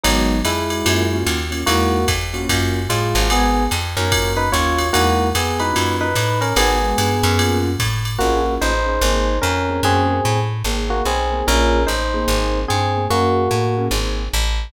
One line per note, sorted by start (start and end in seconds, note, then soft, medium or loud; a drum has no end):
0.03 0.42 G#1 loud
0.03 0.39 F#3 medium
0.03 0.37 G#3 medium
0.03 0.37 B3 medium
0.03 0.39 D#4 medium
0.03 0.37 D#4 medium
0.03 0.37 F#4 medium
0.03 ride loud
0.45 0.83 F2 medium
0.45 1.16 G#3 medium
0.45 1.16 E4 medium
0.45 hi-hat pedal medium
0.45 ride loud
0.70 0.82 G#3 medium
0.70 0.82 B3 medium
0.70 0.82 D#4 medium
0.70 0.82 F#4 medium
0.70 ride medium
0.85 1.24 F#2 loud
0.85 1.03 A#3 medium
0.85 1.03 C#4 medium
0.85 1.03 F4 medium
0.85 1.03 F#4 medium
0.85 ride loud
1.12 1.38 A#3 medium
1.12 1.38 C#4 medium
1.12 1.38 F4 medium
1.12 1.38 F#4 medium
1.26 1.64 D#2 medium
1.26 hi-hat pedal medium
1.26 ride medium
1.51 1.61 A#3 medium
1.51 1.61 C#4 medium
1.51 1.61 F4 medium
1.51 1.61 F#4 medium
1.51 ride medium
1.66 2.06 E2 loud
1.66 1.99 G#3 medium
1.66 2.06 A#3 medium
1.66 1.99 D#4 medium
1.66 1.99 E4 medium
1.66 2.06 F#4 medium
1.66 1.99 F#4 medium
1.66 ride loud
2.08 2.46 F2 medium
2.08 kick medium
2.08 hi-hat pedal medium
2.08 ride loud
2.34 2.80 A#3 medium
2.34 2.80 C#4 medium
2.34 2.80 F4 medium
2.34 2.80 F#4 medium
2.34 ride medium
2.49 2.87 F#2 loud
2.49 kick medium
2.49 ride loud
2.89 3.14 A2 medium
2.89 3.27 G#3 medium
2.89 3.27 F4 medium
2.89 hi-hat pedal medium
2.89 ride medium
3.15 3.68 G#1 loud
3.15 3.27 A#3 medium
3.15 3.27 C#4 medium
3.15 3.27 F4 medium
3.15 3.27 F#4 medium
3.15 ride medium
3.30 3.63 G#3 medium
3.30 3.64 B3 medium
3.30 3.63 B3 medium
3.30 3.63 D#4 medium
3.30 3.63 F#4 medium
3.30 3.64 G#4 medium
3.30 ride loud
3.71 3.96 F2 loud
3.71 hi-hat pedal medium
3.71 ride medium
3.97 4.50 F#2 loud
3.97 4.09 G#3 medium
3.97 4.09 B3 medium
3.97 4.32 C#4 medium
3.97 4.09 D#4 medium
3.97 4.09 F#4 medium
3.97 4.32 A#4 medium
3.97 ride medium
4.12 4.43 A#3 medium
4.12 4.43 C#4 medium
4.12 4.43 F4 medium
4.12 4.43 F#4 medium
4.12 kick medium
4.12 ride loud
4.37 4.49 D#4 medium
4.37 4.49 B4 medium
4.52 4.91 D#2 medium
4.52 4.83 A#3 medium
4.52 4.83 C#4 medium
4.52 4.83 F4 medium
4.52 4.88 F4 medium
4.52 4.83 F#4 medium
4.52 4.88 C#5 medium
4.52 hi-hat pedal loud
4.52 ride medium
4.78 ride medium
4.93 5.33 E2 loud
4.93 5.27 G#3 medium
4.93 5.28 A#3 medium
4.93 5.27 D#4 loud
4.93 5.27 E4 medium
4.93 5.28 F#4 medium
4.93 5.27 F#4 medium
4.93 ride loud
5.35 5.73 F2 medium
5.35 5.59 B3 medium
5.35 5.59 G#4 medium
5.35 hi-hat pedal loud
5.35 ride loud
5.60 5.70 G#3 medium
5.60 5.96 D#4 medium
5.60 5.70 D#4 medium
5.60 5.70 E4 medium
5.60 5.70 F#4 medium
5.60 5.96 B4 medium
5.60 ride medium
5.74 6.14 F#2 medium
5.74 6.05 A#3 medium
5.74 6.05 C#4 medium
5.74 6.05 F4 medium
5.74 6.05 F#4 medium
5.74 ride loud
6.01 6.39 D#4 medium
6.01 6.39 B4 medium
6.15 6.53 A2 medium
6.15 hi-hat pedal medium
6.15 ride loud
6.41 6.54 C#4 medium
6.41 6.54 A#4 medium
6.41 ride medium
6.56 6.94 G#1 loud
6.56 6.77 G#3 medium
6.56 7.58 B3 medium
6.56 6.77 B3 medium
6.56 6.77 D#4 medium
6.56 6.77 F#4 medium
6.56 7.58 G#4 medium
6.56 ride loud
6.82 7.08 G#3 medium
6.82 7.08 B3 medium
6.82 7.08 D#4 medium
6.82 7.08 F#4 medium
6.98 7.22 G2 medium
6.98 hi-hat pedal medium
6.98 ride loud
7.23 7.76 F#2 loud
7.23 ride medium
7.38 7.70 A#3 medium
7.38 7.70 C#4 medium
7.38 7.70 F4 medium
7.38 7.70 F#4 medium
7.38 ride loud
7.79 8.17 A2 medium
7.79 kick medium
7.79 hi-hat pedal medium
7.79 ride loud
8.05 ride medium
8.19 8.58 A#1 medium
8.19 8.54 A#3 medium
8.19 8.40 A#3 medium
8.19 8.40 C#4 medium
8.19 8.40 F4 medium
8.19 8.54 F#4 medium
8.19 8.40 G#4 medium
8.45 8.71 A#3 medium
8.45 8.71 C#4 medium
8.45 8.71 F4 medium
8.45 8.71 G#4 medium
8.61 8.99 A1 medium
8.61 9.38 D#4 medium
8.61 9.38 C5 medium
8.86 8.97 A#3 medium
8.86 8.97 C#4 medium
8.86 8.97 F4 medium
8.86 8.97 G#4 medium
9.01 9.39 G#1 loud
9.01 9.34 A#3 medium
9.01 9.34 C4 medium
9.01 9.34 D#4 medium
9.01 9.34 G#4 medium
9.42 9.81 F2 loud
9.42 9.81 C#4 medium
9.42 9.81 A#4 medium
9.69 9.80 A#3 medium
9.69 9.80 C4 medium
9.69 9.80 D#4 medium
9.69 9.80 G#4 medium
9.83 10.21 F#2 loud
9.83 10.16 A#3 medium
9.83 10.39 C4 medium
9.83 10.16 C#4 medium
9.83 10.16 F#4 medium
9.83 10.16 G#4 loud
9.83 10.39 G#4 medium
10.25 10.63 A2 loud
10.64 11.02 G#1 medium
10.64 10.98 A#3 medium
10.64 10.98 C4 medium
10.64 10.98 D#4 medium
10.64 10.98 G#4 medium
10.90 11.03 A#3 medium
10.90 11.03 F#4 medium
11.05 11.43 B1 medium
11.05 11.45 C4 medium
11.05 11.45 G#4 medium
11.32 11.43 A#3 medium
11.32 11.43 C4 medium
11.32 11.43 D#4 medium
11.32 11.43 G#4 medium
11.47 11.86 A#1 loud
11.47 11.78 A#3 medium
11.47 11.78 C#4 medium
11.47 11.83 C#4 medium
11.47 11.78 F4 medium
11.47 11.78 G#4 medium
11.47 11.83 A#4 medium
11.87 12.26 A1 medium
11.87 12.59 D#4 medium
11.87 12.59 C5 medium
12.14 12.61 A#3 medium
12.14 12.61 C4 medium
12.14 12.61 D#4 medium
12.14 12.61 G#4 medium
12.28 12.65 G#1 loud
12.68 13.08 G2 medium
12.68 13.05 C4 medium
12.68 13.05 G#4 medium
12.97 13.07 A#3 medium
12.97 13.07 C4 medium
12.97 13.07 D#4 medium
12.97 13.07 G#4 medium
13.10 13.48 F#2 medium
13.10 13.86 A#3 medium
13.10 13.43 A#3 medium
13.10 13.43 C#4 medium
13.10 13.86 F#4 medium
13.10 13.43 F#4 medium
13.10 13.43 G#4 medium
13.51 13.89 A2 medium
13.77 13.88 A#3 medium
13.77 13.88 C#4 medium
13.77 13.88 F#4 medium
13.77 13.88 G#4 medium
13.91 14.29 G#1 loud
13.91 14.23 A#3 medium
13.91 14.23 C4 medium
13.91 14.23 D#4 medium
13.91 14.23 G#4 medium
14.33 14.71 A1 loud